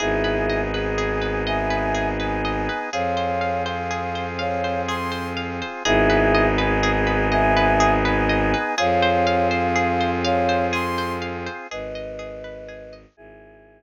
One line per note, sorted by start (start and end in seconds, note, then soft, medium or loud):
0.00 2.68 G#1 loud
0.00 2.90 B3 medium
0.00 2.90 D#4 medium
0.00 0.60 E4 loud
0.00 0.21 G#4 loud
0.00 0.60 G#4 loud
0.00 2.90 G#4 medium
0.24 0.46 B4 medium
0.49 0.71 D#5 medium
0.73 1.42 G#4 medium
0.73 0.96 B4 medium
0.98 1.20 G#4 loud
1.22 1.43 B4 medium
1.46 1.69 D#5 medium
1.46 2.07 E5 medium
1.46 2.07 G#5 loud
1.70 1.92 B4 medium
1.95 2.16 G#4 medium
2.19 2.42 B4 medium
2.19 2.86 G#5 medium
2.45 2.67 D#5 medium
2.69 2.91 B4 medium
2.92 5.62 F2 medium
2.92 5.83 C4 medium
2.92 5.83 F4 medium
2.92 3.15 G#4 loud
2.92 5.83 G#4 medium
2.92 3.62 C#5 medium
2.92 3.62 F5 loud
3.17 3.39 C5 medium
3.41 3.63 F5 medium
3.66 3.88 C5 medium
3.66 4.25 F5 medium
3.91 4.13 G#4 medium
4.15 4.37 C5 medium
4.39 4.81 C#5 medium
4.39 4.61 F5 medium
4.39 4.81 F5 loud
4.64 4.86 C5 medium
4.88 5.10 G#4 loud
4.88 5.27 C6 medium
5.12 5.34 C5 medium
5.37 5.59 F5 medium
5.62 5.84 C5 medium
5.85 8.54 G#1 loud
5.85 8.75 B3 medium
5.85 8.75 D#4 loud
5.85 6.46 E4 loud
5.85 6.07 G#4 loud
5.85 8.75 G#4 medium
5.85 6.46 G#4 loud
6.10 6.32 B4 loud
6.35 6.57 D#5 loud
6.58 7.28 G#4 loud
6.58 6.80 B4 loud
6.83 7.05 G#4 loud
7.07 7.29 B4 medium
7.32 7.54 D#5 loud
7.32 7.93 E5 loud
7.32 7.93 G#5 loud
7.57 7.78 B4 loud
7.80 8.02 G#4 loud
8.05 8.27 B4 loud
8.05 8.72 G#5 loud
8.29 8.51 D#5 loud
8.54 8.76 B4 loud
8.77 11.48 F2 loud
8.77 11.67 C4 medium
8.77 11.67 F4 medium
8.77 11.67 G#4 medium
8.77 9.00 G#4 loud
8.77 9.48 C#5 loud
8.77 9.48 F5 loud
9.02 9.24 C5 loud
9.27 9.49 F5 loud
9.51 9.73 C5 loud
9.51 10.11 F5 loud
9.76 9.97 G#4 loud
10.01 10.22 C5 loud
10.24 10.66 C#5 loud
10.24 10.66 F5 loud
10.24 10.46 F5 loud
10.49 10.71 C5 loud
10.73 10.95 G#4 loud
10.73 11.13 C6 loud
10.98 11.20 C5 loud
11.22 11.44 F5 loud
11.46 11.68 C5 loud
11.71 13.05 G#1 medium
11.71 12.18 G#4 loud
11.71 12.94 B4 loud
11.71 12.94 D#5 loud
11.95 12.92 D#5 medium
12.19 12.68 G#4 medium
12.44 13.14 B4 medium
12.68 13.15 G#4 loud
12.93 13.16 D#5 medium
13.17 13.82 G#1 medium
13.17 13.82 E4 medium
13.17 13.82 G#4 loud